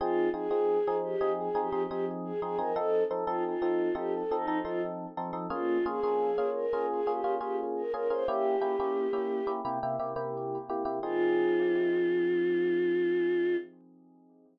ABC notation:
X:1
M:4/4
L:1/16
Q:1/4=87
K:Fm
V:1 name="Choir Aahs"
F2 A4 G2 (3A2 G2 G2 z A A B | =A2 z F F3 G (3A2 E2 F2 z4 | F2 A4 B2 (3A2 G2 G2 z B B c | G8 z8 |
F16 |]
V:2 name="Electric Piano 1"
[F,CEA]2 [F,CEA] [F,CEA]2 [F,CEA]2 [F,CEA]2 [F,CEA] [F,CEA] [F,CEA]3 [F,CEA] [F,CEA] | [F,CE=A]2 [F,CEA] [F,CEA]2 [F,CEA]2 [F,CEA]2 [F,CEA] [F,CEA] [F,CEA]3 [F,CEA] [F,CEA] | [B,DFA]2 [B,DFA] [B,DFA]2 [B,DFA]2 [B,DFA]2 [B,DFA] [B,DFA] [B,DFA]3 [B,DFA] [B,DFA] | [B,D_FG]2 [B,DFG] [B,DFG]2 [B,DFG]2 [B,DFG] [C,B,=EG] [C,B,EG] [C,B,EG] [C,B,EG]3 [C,B,EG] [C,B,EG] |
[F,CEA]16 |]